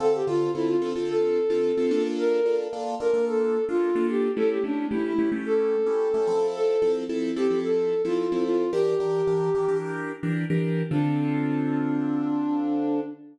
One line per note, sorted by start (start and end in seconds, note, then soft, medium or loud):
0.00 0.22 D3 loud
0.00 0.22 C4 loud
0.00 0.22 F4 medium
0.00 0.13 A4 loud
0.00 0.22 A4 medium
0.14 0.27 G4 medium
0.27 0.49 D3 medium
0.27 0.49 C4 medium
0.27 0.49 F4 loud
0.27 0.51 F4 loud
0.27 0.49 A4 medium
0.55 0.76 D3 medium
0.55 0.76 C4 medium
0.55 0.68 E4 loud
0.55 0.76 F4 medium
0.55 0.76 A4 medium
0.68 0.90 F4 medium
0.82 0.93 D3 medium
0.82 0.93 C4 loud
0.82 0.93 F4 medium
0.82 0.93 A4 medium
0.95 1.39 D3 medium
0.95 1.39 C4 medium
0.95 1.39 F4 medium
0.95 1.39 A4 medium
1.09 2.02 A4 loud
1.50 1.71 D3 medium
1.50 1.71 C4 medium
1.50 1.71 F4 medium
1.50 1.71 A4 medium
1.77 1.90 D3 loud
1.77 1.90 C4 medium
1.77 1.90 F4 medium
1.77 1.90 A4 medium
1.91 2.40 A#3 loud
1.91 2.40 D4 loud
1.91 2.40 F4 loud
1.91 2.40 A4 loud
2.18 2.57 A#4 loud
2.45 2.67 A#3 medium
2.45 2.67 D4 loud
2.45 2.67 F4 medium
2.45 2.67 A4 medium
2.73 2.95 A#3 medium
2.73 2.95 D4 loud
2.73 2.95 F4 medium
2.73 2.95 A4 medium
3.00 3.11 A#3 medium
3.00 3.11 D4 medium
3.00 3.11 F4 medium
3.00 3.11 A4 medium
3.00 3.25 A#4 medium
3.14 3.57 A#3 medium
3.14 3.57 D4 medium
3.14 3.57 F4 medium
3.14 3.57 A4 medium
3.27 3.65 A4 medium
3.68 3.90 A#3 medium
3.68 3.90 D4 medium
3.68 4.07 F4 loud
3.68 3.90 F4 medium
3.68 3.90 A4 medium
3.95 4.28 A#3 medium
3.95 4.28 D4 loud
3.95 4.28 F4 loud
3.95 4.28 A4 loud
4.09 4.31 G4 medium
4.36 4.58 A3 loud
4.36 4.58 C#4 loud
4.36 4.58 E4 loud
4.36 4.58 G4 medium
4.36 4.49 A4 loud
4.50 4.63 G4 medium
4.64 4.85 A3 medium
4.64 4.85 C#4 medium
4.64 4.87 D4 medium
4.64 4.85 E4 medium
4.64 4.85 G4 medium
4.91 5.13 A3 medium
4.91 5.13 C#4 medium
4.91 5.13 E4 medium
4.91 5.04 E4 medium
4.91 5.13 G4 medium
5.05 5.30 E4 medium
5.18 5.29 A3 medium
5.18 5.29 C#4 medium
5.18 5.29 E4 medium
5.18 5.29 G4 medium
5.32 5.75 A3 loud
5.32 5.75 C#4 medium
5.32 5.75 E4 medium
5.32 5.75 G4 medium
5.46 6.47 A4 loud
5.86 6.08 A3 medium
5.86 6.08 C#4 loud
5.86 6.08 E4 medium
5.86 6.08 G4 medium
6.14 6.27 A3 medium
6.14 6.27 C#4 medium
6.14 6.27 E4 loud
6.14 6.27 G4 medium
6.27 6.76 F3 loud
6.27 6.76 C4 loud
6.27 6.76 E4 loud
6.27 6.76 A4 loud
6.55 6.92 A4 loud
6.82 7.04 F3 loud
6.82 7.04 C4 loud
6.82 7.04 E4 medium
6.82 7.04 A4 loud
7.09 7.31 F3 medium
7.09 7.31 C4 medium
7.09 7.31 E4 loud
7.09 7.31 A4 medium
7.36 7.47 F3 medium
7.36 7.47 C4 medium
7.36 7.47 E4 medium
7.36 7.59 G4 medium
7.36 7.47 A4 loud
7.50 7.94 F3 medium
7.50 7.94 C4 medium
7.50 7.94 E4 medium
7.50 7.94 A4 medium
7.64 8.02 A4 medium
8.04 8.26 F3 medium
8.04 8.26 C4 medium
8.04 8.26 E4 medium
8.04 8.44 F4 medium
8.04 8.26 A4 medium
8.32 8.64 F3 medium
8.32 8.64 C4 medium
8.32 8.64 E4 medium
8.32 8.64 A4 medium
8.46 8.71 F4 loud
8.73 8.94 E3 loud
8.73 8.94 D4 loud
8.73 8.94 G4 loud
8.73 9.77 G4 loud
8.73 8.94 A#4 loud
9.00 9.22 E3 medium
9.00 9.22 D4 medium
9.00 9.22 G4 medium
9.00 9.22 A#4 medium
9.27 9.49 E3 medium
9.27 9.49 D4 medium
9.27 9.49 G4 medium
9.27 9.49 A#4 medium
9.55 9.66 E3 loud
9.55 9.66 D4 medium
9.55 9.66 G4 medium
9.55 9.66 A#4 medium
9.68 10.12 E3 medium
9.68 10.12 D4 medium
9.68 10.12 G4 loud
9.68 10.12 A#4 medium
10.23 10.45 E3 medium
10.23 10.45 D4 loud
10.23 10.45 G4 medium
10.23 10.45 A#4 medium
10.50 10.83 E3 medium
10.50 10.83 D4 medium
10.50 10.83 G4 loud
10.50 10.83 A#4 medium
10.91 13.00 D3 medium
10.91 13.00 C4 medium
10.91 13.00 D4 loud
10.91 13.00 F4 loud
10.91 13.00 A4 loud